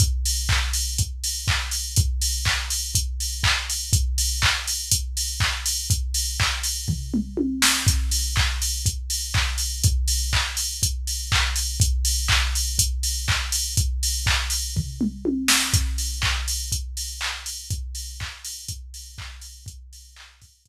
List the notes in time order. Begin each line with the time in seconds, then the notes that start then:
0.00 kick, closed hi-hat
0.25 open hi-hat
0.49 kick, clap
0.73 open hi-hat
0.98 kick, closed hi-hat
1.24 open hi-hat
1.48 kick, clap
1.71 open hi-hat
1.96 kick, closed hi-hat
2.22 open hi-hat
2.45 kick, clap
2.70 open hi-hat
2.95 kick, closed hi-hat
3.20 open hi-hat
3.43 kick, clap
3.70 open hi-hat
3.93 kick, closed hi-hat
4.18 open hi-hat
4.42 kick, clap
4.68 open hi-hat
4.91 kick, closed hi-hat
5.17 open hi-hat
5.40 kick, clap
5.66 open hi-hat
5.90 kick, closed hi-hat
6.14 open hi-hat
6.40 kick, clap
6.63 open hi-hat
6.88 kick, floor tom
7.14 mid tom
7.37 high tom
7.62 snare
7.87 kick, closed hi-hat
8.11 open hi-hat
8.36 kick, clap
8.62 open hi-hat
8.86 kick, closed hi-hat
9.10 open hi-hat
9.34 kick, clap
9.58 open hi-hat
9.84 kick, closed hi-hat
10.08 open hi-hat
10.33 kick, clap
10.57 open hi-hat
10.83 kick, closed hi-hat
11.07 open hi-hat
11.32 kick, clap
11.56 open hi-hat
11.80 kick, closed hi-hat
12.05 open hi-hat
12.28 kick, clap
12.55 open hi-hat
12.79 kick, closed hi-hat
13.03 open hi-hat
13.28 kick, clap
13.52 open hi-hat
13.77 kick, closed hi-hat
14.03 open hi-hat
14.26 kick, clap
14.50 open hi-hat
14.76 kick, floor tom
15.01 mid tom
15.25 high tom
15.48 snare
15.74 kick, closed hi-hat
15.98 open hi-hat
16.22 kick, clap
16.48 open hi-hat
16.72 kick, closed hi-hat
16.97 open hi-hat
17.21 clap
17.46 open hi-hat
17.70 kick, closed hi-hat
17.95 open hi-hat
18.20 kick, clap
18.45 open hi-hat
18.68 kick, closed hi-hat
18.94 open hi-hat
19.18 kick, clap
19.41 open hi-hat
19.66 kick, closed hi-hat
19.93 open hi-hat
20.16 clap
20.42 kick, open hi-hat
20.65 kick, closed hi-hat